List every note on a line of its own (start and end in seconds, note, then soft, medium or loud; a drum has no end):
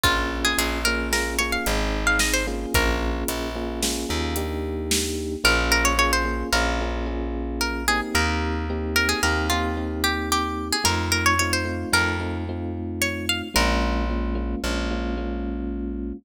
0.03 0.54 A#1 medium
0.03 0.78 A#3 medium
0.03 0.78 C#4 medium
0.03 0.41 F4 loud
0.03 0.78 F4 medium
0.03 0.78 G#4 medium
0.03 kick loud
0.03 closed hi-hat loud
0.45 0.58 G#4 medium
0.58 1.58 A#1 medium
0.58 0.81 G#4 medium
0.58 closed hi-hat loud
0.85 1.11 A#3 medium
0.85 1.11 C#4 medium
0.85 1.11 F4 medium
0.85 1.11 G#4 medium
0.85 1.09 A#4 loud
1.12 1.37 A#3 medium
1.12 1.37 C#4 medium
1.12 1.37 F4 medium
1.12 1.37 G#4 medium
1.12 1.35 A#4 medium
1.12 snare medium
1.39 1.65 A#3 medium
1.39 1.65 C#4 medium
1.39 1.65 F4 medium
1.39 1.65 G#4 medium
1.39 1.51 C#5 medium
1.52 1.99 F5 medium
1.66 2.66 G#1 medium
1.66 2.43 C4 medium
1.66 2.43 D#4 medium
1.66 2.43 G#4 medium
1.66 closed hi-hat loud
2.07 2.20 F5 medium
2.19 2.33 D#5 medium
2.19 snare loud
2.34 2.46 C5 medium
2.47 3.49 A#3 medium
2.47 3.49 C#4 medium
2.47 3.49 F4 medium
2.47 3.49 G#4 medium
2.74 3.24 A#1 medium
2.74 3.64 A#4 medium
2.74 kick loud
2.74 closed hi-hat loud
3.28 4.06 A#1 medium
3.28 closed hi-hat loud
3.56 3.80 A#3 medium
3.56 3.80 C#4 medium
3.56 3.80 F4 medium
3.56 3.80 G#4 medium
3.83 4.08 A#3 medium
3.83 4.08 C#4 medium
3.83 4.08 F4 medium
3.83 4.08 G#4 medium
3.83 snare loud
4.09 5.37 D#2 medium
4.09 4.34 A#3 medium
4.09 4.34 C#4 medium
4.09 4.34 F4 medium
4.09 4.34 G#4 medium
4.36 5.36 A#3 medium
4.36 5.36 D4 medium
4.36 5.36 D#4 medium
4.36 5.36 G4 loud
4.36 closed hi-hat loud
4.91 snare loud
5.44 6.44 A#1 medium
5.44 5.94 A#3 medium
5.44 5.94 C#4 medium
5.44 5.94 F4 medium
5.44 5.94 G#4 medium
5.44 5.71 A#4 loud
5.72 5.85 A#4 loud
5.85 5.98 C#5 loud
5.98 6.23 A#3 medium
5.98 6.23 C#4 medium
5.98 6.23 F4 medium
5.98 6.23 G#4 medium
5.98 6.12 C#5 loud
6.13 6.47 C5 medium
6.25 6.50 A#3 medium
6.25 6.50 C#4 medium
6.25 6.50 F4 medium
6.25 6.50 G#4 medium
6.53 8.02 A#1 medium
6.53 6.79 A#3 medium
6.53 6.79 C#4 medium
6.53 6.79 F4 medium
6.53 6.79 G#4 medium
6.53 7.04 A#4 medium
6.81 7.06 A#3 medium
6.81 7.06 C#4 medium
6.81 7.06 F4 medium
6.81 7.06 G#4 medium
7.06 7.83 A#3 medium
7.06 7.83 C#4 medium
7.06 7.83 F4 medium
7.06 7.83 G#4 medium
7.61 7.86 A#4 medium
7.88 8.65 A#3 medium
7.88 8.65 C4 medium
7.88 8.65 D#4 medium
7.88 8.65 G4 medium
7.88 8.01 G#4 loud
8.15 9.14 D#2 loud
8.15 8.86 A#4 medium
8.70 8.95 A#3 medium
8.70 8.95 C4 medium
8.70 8.95 D#4 medium
8.70 8.95 G4 medium
8.96 9.20 A#3 medium
8.96 9.20 C4 medium
8.96 9.20 D#4 medium
8.96 9.20 G4 medium
8.96 9.09 A#4 loud
9.09 9.22 G#4 medium
9.23 10.72 D#2 medium
9.23 9.49 A#3 medium
9.23 9.49 C4 medium
9.23 9.49 D#4 medium
9.23 9.49 G4 medium
9.23 9.46 A#4 medium
9.50 9.76 A#3 medium
9.50 9.76 C4 medium
9.50 9.76 D#4 medium
9.50 10.02 F4 medium
9.50 9.76 G4 medium
9.77 10.76 A#3 medium
9.77 10.76 C4 medium
9.77 10.76 D#4 medium
9.77 10.76 G4 medium
10.04 10.29 G4 medium
10.32 10.68 G4 loud
10.73 10.85 G#4 loud
10.84 11.85 F2 medium
10.84 11.34 A3 medium
10.84 11.34 C4 medium
10.84 11.34 D#4 medium
10.84 11.34 F4 medium
10.84 11.08 A#4 loud
11.12 11.25 A#4 loud
11.26 11.39 C#5 loud
11.39 11.65 A3 medium
11.39 11.65 C4 medium
11.39 11.65 D#4 medium
11.39 11.65 F4 medium
11.39 11.52 C#5 medium
11.53 11.92 C5 loud
11.65 11.90 A3 medium
11.65 11.90 C4 medium
11.65 11.90 D#4 medium
11.65 11.90 F4 medium
11.93 13.42 F2 medium
11.93 12.17 A3 medium
11.93 12.17 C4 medium
11.93 12.17 D#4 medium
11.93 12.17 F4 medium
11.93 12.37 A#4 loud
12.20 12.45 A3 medium
12.20 12.45 C4 medium
12.20 12.45 D#4 medium
12.20 12.45 F4 medium
12.49 13.48 A3 medium
12.49 13.48 C4 medium
12.49 13.48 D#4 medium
12.49 13.48 F4 medium
13.02 13.26 C#5 loud
13.29 13.42 F5 medium
13.54 14.55 A#1 loud
13.54 14.04 G#3 medium
13.54 14.04 A#3 medium
13.54 14.04 C#4 medium
13.54 14.04 F4 medium
13.54 14.59 A#4 loud
14.10 14.35 G#3 medium
14.10 14.35 A#3 medium
14.10 14.35 C#4 medium
14.10 14.35 F4 medium
14.35 14.60 G#3 medium
14.35 14.60 A#3 medium
14.35 14.60 C#4 medium
14.35 14.60 F4 medium
14.64 16.13 A#1 medium
14.64 14.89 G#3 medium
14.64 14.89 A#3 medium
14.64 14.89 C#4 medium
14.64 14.89 F4 medium
14.91 15.16 G#3 medium
14.91 15.16 A#3 medium
14.91 15.16 C#4 medium
14.91 15.16 F4 medium
15.17 16.17 G#3 medium
15.17 16.17 A#3 medium
15.17 16.17 C#4 medium
15.17 16.17 F4 medium